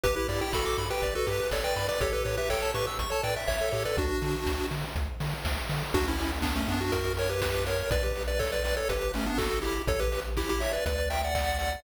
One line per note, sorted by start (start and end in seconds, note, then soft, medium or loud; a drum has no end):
0.03 0.18 G1 medium
0.03 0.15 G4 medium
0.03 0.15 B4 medium
0.03 kick loud
0.03 closed hi-hat loud
0.16 0.27 E4 medium
0.16 0.27 G4 medium
0.16 0.27 B4 medium
0.28 0.42 G2 medium
0.28 0.41 E4 medium
0.28 0.41 G4 medium
0.28 0.40 D5 medium
0.28 open hi-hat medium
0.41 0.53 E4 medium
0.41 0.53 G4 medium
0.41 0.52 G5 medium
0.53 0.67 G1 medium
0.53 0.84 F#4 medium
0.53 0.84 A4 medium
0.53 0.64 B5 medium
0.53 kick loud
0.53 snare loud
0.65 0.76 D6 medium
0.78 0.91 G2 medium
0.78 0.89 B5 medium
0.78 open hi-hat medium
0.90 1.14 G4 medium
0.90 1.14 B4 medium
0.90 1.01 G5 medium
1.02 1.16 G1 medium
1.02 1.13 D5 medium
1.02 kick medium
1.02 closed hi-hat loud
1.15 1.27 F#4 medium
1.15 1.27 A4 medium
1.15 1.26 B4 medium
1.26 1.41 G2 medium
1.26 1.48 G4 medium
1.26 1.38 G4 medium
1.26 1.48 B4 medium
1.26 open hi-hat medium
1.39 1.50 B4 medium
1.51 1.65 G1 medium
1.51 1.64 A4 soft
1.51 1.64 C#5 medium
1.51 1.62 D5 medium
1.51 kick medium
1.51 snare loud
1.64 1.87 B4 medium
1.64 1.87 D5 medium
1.64 1.75 G5 medium
1.76 1.90 G2 medium
1.76 1.87 B5 medium
1.76 open hi-hat medium
1.88 2.00 B4 medium
1.88 2.00 D5 medium
1.88 1.99 D6 medium
2.01 2.14 A1 medium
2.01 2.12 G4 medium
2.01 2.13 A4 medium
2.01 2.13 C#5 medium
2.01 kick loud
2.01 closed hi-hat loud
2.13 2.24 G4 medium
2.13 2.24 A4 medium
2.13 2.24 B4 medium
2.24 2.39 A2 medium
2.24 2.36 G4 medium
2.24 2.36 B4 medium
2.24 2.36 C#5 medium
2.24 open hi-hat medium
2.37 2.49 G4 medium
2.37 2.49 B4 medium
2.37 2.49 E5 medium
2.50 2.63 A1 medium
2.50 2.71 A4 medium
2.50 2.71 C#5 medium
2.50 2.61 G5 medium
2.50 kick medium
2.50 clap loud
2.62 2.73 A5 medium
2.74 2.88 A2 medium
2.74 2.86 G4 medium
2.74 2.86 B4 medium
2.74 2.85 C#6 medium
2.74 open hi-hat medium
2.87 2.98 E6 medium
2.99 3.12 A1 medium
2.99 3.10 C#6 medium
2.99 kick medium
2.99 closed hi-hat loud
3.10 3.22 A4 soft
3.10 3.22 C#5 medium
3.10 3.22 A5 medium
3.23 3.37 A2 medium
3.23 3.35 B4 medium
3.23 3.35 D5 medium
3.23 3.35 G5 medium
3.23 open hi-hat medium
3.36 3.47 E5 medium
3.48 3.62 A1 medium
3.48 3.69 C#5 medium
3.48 3.59 C#5 medium
3.48 3.69 E5 medium
3.48 kick medium
3.48 clap loud
3.60 3.72 A4 medium
3.72 3.86 A2 medium
3.72 3.84 G4 medium
3.72 3.83 A4 medium
3.72 3.83 C#5 medium
3.72 open hi-hat medium
3.85 3.96 A4 medium
3.85 3.97 B4 medium
3.85 3.97 D5 medium
3.97 4.11 D2 loud
3.97 4.66 D4 medium
3.97 4.66 F#4 medium
3.97 kick loud
3.97 closed hi-hat loud
4.22 4.35 D3 medium
4.22 open hi-hat medium
4.46 4.60 D2 medium
4.46 kick medium
4.46 snare loud
4.71 4.84 D3 medium
4.71 open hi-hat medium
4.96 5.09 D2 medium
4.96 kick medium
4.96 closed hi-hat loud
5.20 5.34 D3 medium
5.20 open hi-hat medium
5.45 5.58 D2 medium
5.45 kick medium
5.45 snare loud
5.69 5.83 D3 medium
5.69 open hi-hat medium
5.94 6.64 D2 medium
5.94 6.06 D4 medium
5.94 6.06 F#4 medium
5.94 kick loud
5.94 crash loud
6.06 6.31 C#4 medium
6.06 6.31 E4 medium
6.06 closed hi-hat medium
6.19 open hi-hat medium
6.31 closed hi-hat medium
6.42 6.54 B3 medium
6.42 6.54 D4 medium
6.42 kick loud
6.42 clap loud
6.56 6.68 A3 medium
6.56 6.68 C#4 medium
6.56 closed hi-hat medium
6.68 7.83 F#2 medium
6.68 6.80 B3 medium
6.68 6.80 D4 medium
6.68 open hi-hat medium
6.80 6.92 D4 medium
6.80 6.91 F#4 medium
6.80 closed hi-hat medium
6.92 7.13 F#4 medium
6.92 7.13 A#4 medium
6.92 kick loud
6.92 closed hi-hat loud
7.05 closed hi-hat medium
7.17 7.30 A#4 medium
7.17 7.30 C#5 medium
7.17 open hi-hat loud
7.29 7.41 G4 medium
7.29 7.41 B4 medium
7.29 closed hi-hat medium
7.42 7.65 G4 medium
7.42 7.65 B4 medium
7.42 kick loud
7.42 snare loud
7.54 closed hi-hat medium
7.66 7.90 A#4 medium
7.66 7.90 C#5 medium
7.66 open hi-hat medium
7.78 closed hi-hat medium
7.91 8.81 B1 medium
7.91 8.02 B4 medium
7.91 8.03 D5 medium
7.91 kick loud
7.91 closed hi-hat loud
8.03 8.23 G4 medium
8.03 8.23 B4 medium
8.03 closed hi-hat medium
8.15 open hi-hat medium
8.28 8.39 B4 medium
8.28 8.39 D5 medium
8.28 closed hi-hat medium
8.39 8.51 A4 medium
8.39 8.51 C#5 medium
8.39 kick loud
8.39 clap loud
8.52 8.63 B4 medium
8.52 8.63 D5 medium
8.52 closed hi-hat medium
8.64 8.76 B4 medium
8.64 8.76 D5 medium
8.64 open hi-hat medium
8.77 8.88 A4 medium
8.77 8.88 C#5 medium
8.77 closed hi-hat medium
8.89 9.80 G1 medium
8.89 9.12 G4 medium
8.89 9.12 B4 medium
8.89 kick medium
8.89 closed hi-hat loud
9.01 closed hi-hat medium
9.14 9.26 A3 medium
9.14 9.26 C#4 medium
9.14 open hi-hat medium
9.26 9.38 B3 medium
9.26 9.38 D4 medium
9.26 closed hi-hat medium
9.38 9.59 F#4 medium
9.38 9.59 A4 medium
9.38 kick loud
9.38 clap loud
9.51 closed hi-hat medium
9.62 9.82 E4 medium
9.62 9.82 G4 medium
9.62 open hi-hat medium
9.75 closed hi-hat medium
9.87 10.78 A1 loud
9.87 10.00 A4 medium
9.87 10.00 C#5 medium
9.87 kick loud
9.87 closed hi-hat loud
10.00 10.20 G4 medium
10.00 10.20 B4 medium
10.00 closed hi-hat medium
10.12 open hi-hat medium
10.24 closed hi-hat medium
10.37 10.49 E4 medium
10.37 10.49 G4 medium
10.37 kick medium
10.37 clap loud
10.49 10.61 E4 medium
10.49 10.61 G4 medium
10.49 closed hi-hat medium
10.60 10.72 C#5 medium
10.60 10.72 E5 medium
10.60 open hi-hat medium
10.73 10.85 B4 medium
10.73 10.85 D5 medium
10.73 closed hi-hat medium
10.86 11.76 D2 loud
10.86 11.09 B4 medium
10.86 11.09 D5 medium
10.86 kick medium
10.86 closed hi-hat loud
10.98 closed hi-hat medium
11.10 11.22 E5 medium
11.10 11.22 G5 medium
11.10 open hi-hat loud
11.23 11.34 D5 medium
11.23 11.34 F#5 medium
11.23 closed hi-hat medium
11.35 11.58 D5 medium
11.35 11.58 F#5 medium
11.35 kick loud
11.35 clap loud
11.47 closed hi-hat medium
11.59 11.80 D5 medium
11.59 11.80 F#5 medium
11.59 open hi-hat medium
11.72 closed hi-hat medium